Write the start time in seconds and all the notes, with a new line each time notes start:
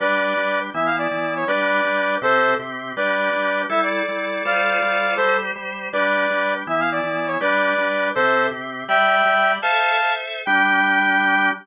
0.00 G3 D4 G4 B4 D5
0.37 G3 D4 G4
0.74 E3 B3 E4 E5
0.86 F5
0.98 D5
1.11 E3 B3 E4
1.36 C#5
1.47 G3 D4 G4 B4 D5
1.84 G3 D4 G4
2.22 C3 C4 G4 A4 C5
2.59 C3 C4 G4
2.96 G3 D4 G4 B4 D5
3.33 G3 D4 G4
3.69 G3 E4 A4 E5
3.83 D5
4.08 G3 E4 A4
4.45 G3 F4 A4 C5 D5 F5
4.82 G3 F4 A4 C5
5.16 G3 G4 A4 C5
5.56 G3 G4 C5
5.93 G3 D4 G4 B4 D5
6.30 G3 D4 G4
6.67 E3 B3 E4 E5
6.80 F5
6.92 D5
7.04 E3 B3 E4
7.27 C#5
7.40 G3 D4 G4 B4 D5
7.78 G3 D4 G4
8.15 C3 C4 G4 A4 C5
8.51 C3 C4 G4
8.88 G3 G4 D5 E5 G5
9.25 G3 G4 D5
9.62 A4 C5 E5 F5 A5
10.02 A4 C5 E5
10.45 G3 D4 G4 G5